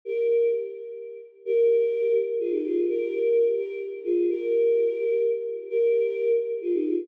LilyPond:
\new Staff { \time 6/8 \key bes \mixolydian \tempo 4. = 85 <g' bes'>4 r2 | <g' bes'>4. r8 <f' aes'>16 <ees' g'>16 <f' aes'>8 | <g' bes'>4. <g' bes'>8 r8 <f' aes'>8 | <g' bes'>2 r4 |
<g' bes'>4. r8 <f' aes'>16 <ees' g'>16 <f' aes'>8 | }